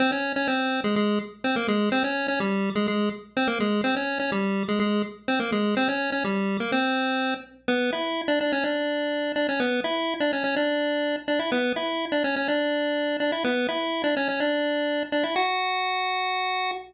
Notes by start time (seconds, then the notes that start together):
0.00 C4 C5
0.12 C#4 C#5
0.36 C#4 C#5
0.48 C4 C5
0.84 G#3 G#4
0.96 G#3 G#4
1.44 C4 C5
1.56 A#3 A#4
1.68 G#3 G#4
1.92 C4 C5
2.04 C#4 C#5
2.28 C#4 C#5
2.40 G3 G4
2.75 G#3 G#4
2.88 G#3 G#4
3.37 C4 C5
3.47 A#3 A#4
3.60 G#3 G#4
3.84 C4 C5
3.96 C#4 C#5
4.20 C#4 C#5
4.32 G3 G4
4.68 G#3 G#4
4.80 G#3 G#4
5.28 C4 C5
5.40 A#3 A#4
5.52 G#3 G#4
5.77 C4 C5
5.88 C#4 C#5
6.12 C#4 C#5
6.24 G3 G4
6.60 A#3 A#4
6.72 C4 C5
7.68 B3 B4
7.92 E4 E5
8.28 D4 D5
8.41 D4 D5
8.52 C#4 C#5
8.64 D4 D5
9.36 D4 D5
9.49 C#4 C#5
9.60 B3 B4
9.84 E4 E5
10.20 D4 D5
10.33 C#4 C#5
10.44 C#4 C#5
10.56 D4 D5
11.28 D4 D5
11.39 E4 E5
11.52 B3 B4
11.76 E4 E5
12.12 D4 D5
12.24 C#4 C#5
12.36 C#4 C#5
12.48 D4 D5
13.20 D4 D5
13.32 E4 E5
13.44 B3 B4
13.69 E4 E5
14.04 D4 D5
14.17 C#4 C#5
14.29 C#4 C#5
14.40 D4 D5
15.12 D4 D5
15.23 E4 E5
15.36 F#4 F#5